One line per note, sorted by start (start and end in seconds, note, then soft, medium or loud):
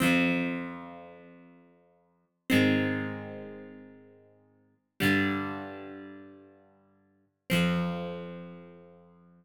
0.00 2.25 F2 loud
0.00 2.25 F3 loud
0.00 2.25 C4 loud
2.50 4.75 G#2 loud
2.50 4.75 D#3 loud
2.50 4.75 C4 loud
5.00 7.25 G2 loud
5.00 7.25 D3 loud
5.00 7.25 G3 loud
7.50 9.45 F2 loud
7.50 9.45 F3 loud
7.50 9.45 C4 medium